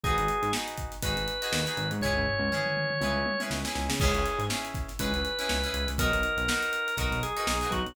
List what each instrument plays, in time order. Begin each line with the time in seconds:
0.04 synth bass 1 G#1, acoustic guitar (steel) D#4 F#4 G#4 B4, drawbar organ G#4, kick
0.18 synth bass 1 G#1, closed hi-hat
0.28 closed hi-hat
0.42 synth bass 1 G#2, closed hi-hat
0.53 acoustic guitar (steel) D#4 F#4 G#4 B4, snare
0.68 closed hi-hat
0.77 kick, closed hi-hat
0.92 snare, closed hi-hat
1.02 synth bass 1 G#1, acoustic guitar (steel) D#4 F#4 G#4 B4, drawbar organ B4, kick, closed hi-hat
1.16 synth bass 1 G#1, closed hi-hat
1.28 closed hi-hat
1.42 acoustic guitar (steel) D#4 F#4 G#4 B4, closed hi-hat
1.52 synth bass 1 D#2, snare
1.66 acoustic guitar (steel) D#4 F#4 G#4 B4, closed hi-hat
1.77 synth bass 1 G#1, closed hi-hat
1.91 synth bass 1 G#2, closed hi-hat
2.01 synth bass 1 C#2, acoustic guitar (steel) C#4 E4 G#4, drawbar organ C#5, kick, floor tom
2.05 acoustic guitar (steel) B4
2.16 synth bass 1 C#2, floor tom
2.27 floor tom
2.39 synth bass 1 C#2
2.51 acoustic guitar (steel) C#4 E4 G#4 B4, mid tom
2.66 mid tom
2.77 mid tom
2.90 mid tom
3.01 synth bass 1 C#2, acoustic guitar (steel) C#4 E4 G#4 B4, high tom
3.14 synth bass 1 C#2
3.26 high tom
3.40 acoustic guitar (steel) C#4 E4 G#4 B4, high tom
3.50 synth bass 1 C#2, snare
3.65 acoustic guitar (steel) C#4 E4 G#4 B4, snare
3.75 synth bass 1 C#2, snare
3.89 synth bass 1 C#3, snare
4.00 synth bass 1 C#2, acoustic guitar (steel) C#4 E4 G#4 B4, drawbar organ G#4, kick, crash
4.15 synth bass 1 C#2, closed hi-hat
4.26 closed hi-hat
4.39 synth bass 1 G#2, closed hi-hat
4.50 acoustic guitar (steel) C#4 E4 G#4 B4, snare
4.65 closed hi-hat
4.74 kick, snare, closed hi-hat
4.88 snare, closed hi-hat
4.99 synth bass 1 C#2, acoustic guitar (steel) C#4 E4 G#4 B4, drawbar organ B4, kick, closed hi-hat
5.13 synth bass 1 C#2, snare, closed hi-hat
5.25 closed hi-hat
5.39 acoustic guitar (steel) C#4 E4 G#4 B4, closed hi-hat
5.49 synth bass 1 C#2, snare
5.64 acoustic guitar (steel) C#4 E4 G#4 B4, closed hi-hat
5.73 synth bass 1 C#2, snare, closed hi-hat
5.88 synth bass 1 C#2, snare, closed hi-hat
5.98 synth bass 1 B1, acoustic guitar (steel) D#4 F#4 A#4 B4, drawbar organ A#4, kick, closed hi-hat
6.12 synth bass 1 B1, closed hi-hat
6.23 closed hi-hat
6.37 synth bass 1 B1, closed hi-hat
6.48 acoustic guitar (steel) D#4 F#4 A#4 B4, snare
6.63 closed hi-hat
6.73 closed hi-hat
6.88 closed hi-hat
6.97 synth bass 1 B1, acoustic guitar (steel) D#4 F#4 A#4 B4, drawbar organ A#4, kick, closed hi-hat
7.11 synth bass 1 B1, snare, closed hi-hat
7.23 drawbar organ G#4, closed hi-hat
7.37 acoustic guitar (steel) D#4 F#4 A#4 B4, closed hi-hat
7.47 synth bass 1 B1, drawbar organ G#4, snare
7.61 acoustic guitar (steel) D#4 F#4 A#4 B4, snare, closed hi-hat
7.71 synth bass 1 B1, drawbar organ F#4, kick, snare, closed hi-hat
7.86 synth bass 1 B1, closed hi-hat